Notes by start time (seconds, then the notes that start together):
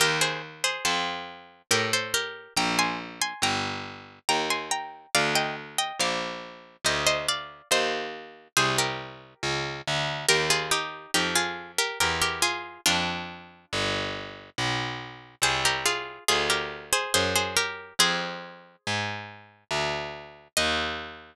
0.00 D#2 G4 A#4
0.21 G#4 C5
0.64 G#4 C5
0.85 F2 A4 C5
1.71 A2 G4 A#4
1.93 A4 C5
2.14 G4 A#4
2.56 A#1 G5 A#5
2.79 G#5 C6
3.21 G#5 C6
3.42 G1 G5 A#5
4.29 D#2 G5 A#5
4.50 G#5 C6
4.71 G5 A#5
5.15 D2 D5 F5
5.35 D#5 G5
5.78 D#5 G5
5.99 A#1 D5 F5
6.84 D2 C5 D#5
7.06 C5 D#5
7.28 D5 F5
7.71 D#2 C5 D#5
8.57 C2 G#4 C5
8.78 G4 A#4
9.43 C#2
9.88 D2
10.29 D#2 G4 A#4
10.50 F4 G#4
10.71 D#4 G4
11.14 F2 D#4 G4
11.36 F4 G#4
11.78 G4 A#4
12.00 E2 G4 A#4
12.22 G4 A#4
12.42 F4 G#4
12.86 F2 D4 F4
13.73 G1
14.58 B1
15.42 C2 G#4 C5
15.65 G4 A#4
15.86 F4 G#4
16.28 D2 F4 G#4
16.50 G4 A#4
16.93 G#4 C5
17.14 F#2 G#4 C5
17.36 G#4 C5
17.57 G4 A#4
17.99 F2 G#4 C5
18.87 G#2
19.71 D2
20.57 D#2 D#5